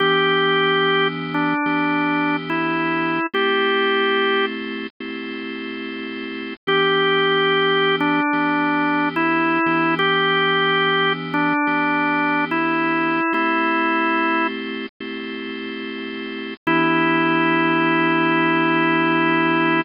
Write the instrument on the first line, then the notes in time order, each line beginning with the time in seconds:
drawbar organ
0.00 E3 B3 D4 G4
1.34 D4
1.66 E3 B3 D4 G4
2.50 E4
3.34 A3 C4 E4 G4
5.00 A3 C4 E4 G4
6.67 E3 B3 D4 G4
8.00 D4
8.33 E3 B3 D4 G4
9.16 E4
9.66 E3 B3 D4 G4
9.99 G4
11.34 D4
11.67 E3 B3 D4 G4
12.51 E4
13.33 A3 C4 E4 G4
15.00 A3 C4 E4 G4
16.67 E3 B3 D4 E4 G4